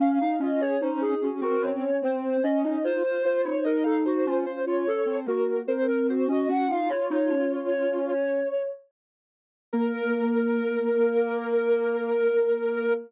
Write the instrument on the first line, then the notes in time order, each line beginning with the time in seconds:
ocarina
0.00 C#4 F5
0.21 D#4 F5
0.40 C#4 F4 D#5
0.60 G#4 C#5
0.81 C#4 D#4 C5
1.01 D#4 G#4
1.21 C#4 F#4
1.41 C4 F#4 A#4
1.61 C#4 C#5
2.02 C4 C5
2.43 C#4 D#5
2.64 C#4 D#4 D#5
2.84 F4 C5
3.04 F4 C5
3.22 F4 C5
3.45 D#4 C5 C#5
3.64 D#4 A#4 D#5
3.84 D#4 A4 F5
4.05 D#4 F#4 C5
4.26 C#4 F4
4.46 C#4 C5
4.66 F4 C#5
4.87 C#4 A4
5.06 C4
5.26 A#3 F#4 A#4
5.67 C4 A#4 C5
5.88 C4 A#4
6.08 F#4 C5
6.28 C#4 F#4 D#5
6.48 C#4 F#4 F#5
6.67 D#4 F4 F5
6.89 F4 C#5
7.10 D#4
7.29 C#4
9.73 A#3 A#4